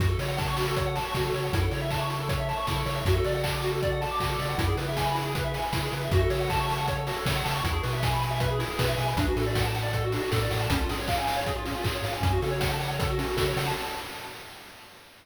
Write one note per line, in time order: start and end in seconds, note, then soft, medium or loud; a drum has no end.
0.00 0.16 F#2 medium
0.00 0.08 F#4 medium
0.00 kick loud
0.00 closed hi-hat medium
0.09 0.18 A4 medium
0.19 1.00 C#3 medium
0.19 0.28 C#5 medium
0.19 open hi-hat medium
0.28 0.37 F#5 medium
0.38 0.47 A5 medium
0.38 kick medium
0.38 snare medium
0.47 0.56 C#6 medium
0.57 0.66 F#4 medium
0.57 open hi-hat medium
0.68 0.76 A4 medium
0.76 0.85 C#5 medium
0.76 kick medium
0.76 closed hi-hat medium
0.86 0.95 F#5 medium
0.96 1.04 A5 medium
0.96 open hi-hat medium
1.05 1.13 C#6 medium
1.14 1.31 C#3 medium
1.14 1.24 F#4 medium
1.14 kick medium
1.14 snare medium
1.25 1.33 A4 medium
1.34 1.50 C#3 medium
1.34 1.43 C#5 medium
1.34 open hi-hat medium
1.44 1.52 F#5 medium
1.53 1.69 F#2 medium
1.53 1.62 E4 medium
1.53 kick loud
1.53 closed hi-hat loud
1.62 1.70 A4 medium
1.71 2.53 C#3 medium
1.71 1.80 C#5 medium
1.71 open hi-hat medium
1.82 1.90 E5 medium
1.90 2.00 A5 medium
1.90 kick medium
1.90 clap medium
2.01 2.09 C#6 medium
2.10 2.19 E4 medium
2.10 open hi-hat medium
2.20 2.29 A4 medium
2.29 2.38 C#5 medium
2.29 kick medium
2.29 closed hi-hat medium
2.40 2.48 E5 medium
2.49 2.57 A5 medium
2.49 open hi-hat medium
2.57 2.66 C#6 medium
2.67 2.84 C#3 medium
2.67 2.77 E4 medium
2.67 kick medium
2.67 snare medium
2.76 2.85 A4 medium
2.86 3.03 C#3 medium
2.86 2.94 C#5 medium
2.86 open hi-hat medium
2.96 3.04 E5 medium
3.05 3.21 F#2 medium
3.05 3.15 F#4 medium
3.05 kick loud
3.05 closed hi-hat loud
3.16 3.24 A4 medium
3.24 4.06 C#3 medium
3.24 3.33 D5 medium
3.24 open hi-hat medium
3.35 3.43 F#5 medium
3.44 3.52 A5 medium
3.44 kick medium
3.44 clap loud
3.53 3.61 D6 medium
3.63 3.72 F#4 medium
3.63 open hi-hat medium
3.72 3.80 A4 medium
3.82 3.91 D5 medium
3.82 kick medium
3.82 closed hi-hat medium
3.92 4.01 F#5 medium
4.01 4.09 A5 medium
4.01 open hi-hat medium
4.11 4.20 D6 medium
4.20 4.36 C#3 medium
4.20 4.29 F#4 medium
4.20 kick medium
4.20 clap medium
4.30 4.38 A4 medium
4.39 4.55 C#3 medium
4.39 4.48 D5 medium
4.39 open hi-hat medium
4.49 4.57 F#5 medium
4.58 4.75 F#2 medium
4.58 4.66 E4 medium
4.58 kick loud
4.58 closed hi-hat loud
4.68 4.77 G#4 medium
4.77 5.58 C#3 medium
4.77 4.86 B4 medium
4.77 open hi-hat medium
4.88 4.96 E5 medium
4.96 5.06 G#5 medium
4.96 kick medium
4.96 snare loud
5.05 5.14 B5 medium
5.15 5.23 E4 medium
5.15 open hi-hat medium
5.25 5.34 G#4 medium
5.35 5.44 B4 medium
5.35 kick medium
5.35 closed hi-hat medium
5.44 5.53 E5 medium
5.54 5.63 G#5 medium
5.54 open hi-hat medium
5.63 5.72 B5 medium
5.73 5.89 C#3 medium
5.73 5.82 E4 medium
5.73 kick medium
5.73 snare loud
5.83 5.91 G#4 medium
5.92 6.09 C#3 medium
5.92 6.02 B4 medium
5.92 open hi-hat medium
6.02 6.11 E5 medium
6.11 6.27 F#2 medium
6.11 6.21 F#4 loud
6.11 kick loud
6.11 closed hi-hat medium
6.21 6.29 A4 medium
6.30 7.12 C#3 medium
6.30 6.39 C#5 medium
6.30 open hi-hat medium
6.40 6.49 F#5 medium
6.50 6.58 A5 medium
6.50 kick medium
6.50 clap medium
6.60 6.69 C#6 medium
6.68 6.77 A5 medium
6.68 open hi-hat medium
6.78 6.86 F#5 medium
6.88 6.97 C#5 medium
6.88 kick medium
6.88 closed hi-hat medium
6.98 7.06 A4 medium
7.07 7.16 F#4 medium
7.07 open hi-hat medium
7.16 7.25 A4 medium
7.26 7.42 C#3 medium
7.26 7.35 C#5 medium
7.26 kick medium
7.26 snare loud
7.36 7.44 F#5 medium
7.44 7.62 C#3 medium
7.44 7.53 A5 medium
7.44 open hi-hat medium
7.55 7.63 C#6 medium
7.64 7.80 E2 medium
7.64 7.72 E4 loud
7.64 kick medium
7.64 closed hi-hat loud
7.73 7.81 G#4 medium
7.83 8.65 B2 medium
7.83 7.91 B4 medium
7.83 open hi-hat medium
7.93 8.01 E5 medium
8.03 8.12 G#5 medium
8.03 kick medium
8.03 snare loud
8.13 8.21 B5 medium
8.22 8.30 G#5 medium
8.22 open hi-hat medium
8.31 8.39 E5 medium
8.40 8.49 B4 medium
8.40 kick medium
8.40 closed hi-hat medium
8.50 8.59 G#4 medium
8.59 8.67 E4 medium
8.59 open hi-hat medium
8.70 8.78 G#4 medium
8.79 8.95 B2 medium
8.79 8.88 B4 medium
8.79 kick medium
8.79 snare loud
8.88 8.97 E5 medium
8.97 9.14 B2 medium
8.97 9.06 G#5 medium
8.97 open hi-hat medium
9.08 9.17 B5 medium
9.17 9.33 D2 medium
9.17 9.26 D4 medium
9.17 kick loud
9.17 closed hi-hat loud
9.28 9.36 F#4 medium
9.36 10.18 A2 medium
9.36 9.45 A4 medium
9.36 open hi-hat medium
9.46 9.55 D5 medium
9.55 9.64 F#5 medium
9.55 kick medium
9.55 snare loud
9.65 9.74 A5 medium
9.75 9.84 F#5 medium
9.75 open hi-hat medium
9.83 9.92 D5 medium
9.93 10.03 A4 medium
9.93 kick medium
9.93 closed hi-hat medium
10.04 10.12 F#4 medium
10.12 10.22 D4 medium
10.12 open hi-hat medium
10.22 10.30 F#4 medium
10.31 10.48 A2 medium
10.31 10.40 A4 medium
10.31 kick medium
10.31 snare loud
10.42 10.51 D5 medium
10.51 10.67 A2 medium
10.51 10.59 F#5 medium
10.51 open hi-hat medium
10.61 10.70 A5 medium
10.70 10.86 C#2 medium
10.70 10.79 C#4 loud
10.70 kick loud
10.70 closed hi-hat loud
10.80 10.89 F4 medium
10.89 11.71 G#2 medium
10.89 10.98 G#4 medium
10.89 open hi-hat medium
10.98 11.07 C#5 medium
11.08 11.17 F5 medium
11.08 kick medium
11.08 clap loud
11.18 11.27 G#5 medium
11.27 11.37 F5 medium
11.27 open hi-hat medium
11.36 11.45 C#5 medium
11.46 11.55 G#4 medium
11.46 kick medium
11.46 closed hi-hat medium
11.56 11.64 F4 medium
11.66 11.74 C#4 medium
11.66 open hi-hat medium
11.75 11.84 F4 medium
11.84 12.01 G#2 medium
11.84 11.92 G#4 medium
11.84 kick medium
11.84 clap loud
11.94 12.03 C#5 medium
12.04 12.20 G#2 medium
12.04 12.13 F5 medium
12.04 open hi-hat medium
12.13 12.21 G#5 medium
12.22 12.39 F#2 medium
12.22 12.30 C#4 medium
12.22 kick medium
12.22 closed hi-hat medium
12.32 12.41 F#4 medium
12.42 13.23 C#3 medium
12.42 12.51 A4 medium
12.42 open hi-hat medium
12.51 12.59 C#5 medium
12.60 12.69 F#5 medium
12.60 kick medium
12.60 snare loud
12.72 12.80 A5 medium
12.80 12.88 F#5 medium
12.80 open hi-hat medium
12.90 12.99 C#5 medium
12.99 13.08 A4 medium
12.99 kick loud
12.99 closed hi-hat loud
13.10 13.18 F#4 medium
13.18 13.27 C#4 medium
13.18 open hi-hat medium
13.27 13.36 F#4 medium
13.37 13.53 C#3 medium
13.37 13.45 A4 medium
13.37 kick medium
13.37 snare loud
13.48 13.56 C#5 medium
13.57 13.73 C#3 medium
13.57 13.66 F#5 medium
13.57 open hi-hat medium
13.66 13.75 A5 medium